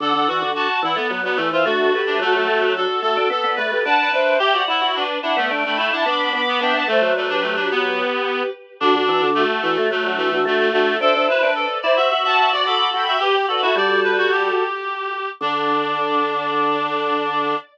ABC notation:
X:1
M:4/4
L:1/16
Q:1/4=109
K:Dmix
V:1 name="Violin"
[df] [df]3 [fa]2 [df]2 z [Bd]2 [ce] [DF]2 [GB]2 | [FA] [FA]3 [DF]2 [FA]2 z [Bd]2 [GB] [fa]2 [ce]2 | [eg] [df]3 [Bd]2 [df]2 z [gb]2 [fa] [bd']2 [bd']2 | [eg] [fa] [ce]2 [Bd] [GB]9 z2 |
[DF] [DF]3 [FA]2 [DF]2 z [DF]2 [DF] [DF]2 [DF]2 | [ce] [ce]3 [Bd]2 [ce]2 z [fa]2 [df] [bd']2 [gb]2 | [GB] z [Bd] [FA]9 z4 | d16 |]
V:2 name="Clarinet"
A2 F2 F2 E B,2 B, A, ^E F3 D | A,4 A2 A2 A2 B2 B B B2 | G2 E2 D2 D A,2 A, A, D D3 B, | D2 A,2 A, D A, D B,6 z2 |
D4 A,2 A,2 A,2 A,2 A, A, A,2 | A2 B2 A2 d e2 e e d A3 e | G2 A F d2 B F G8 | D16 |]
V:3 name="Drawbar Organ"
D, D, E, D,2 z E, A, F, F, E, E, A,2 A,2 | F, F, A, F,2 z A, D B, B, A, A, D2 D2 | G F E F2 z E B, D D E E B,2 B,2 | B, B, A, F,9 z4 |
D, D, E, D,2 z E, A, F, F, E, E, A,2 A,2 | D D E D2 z E F F F F F F2 F2 | G2 F E G,6 z6 | D,16 |]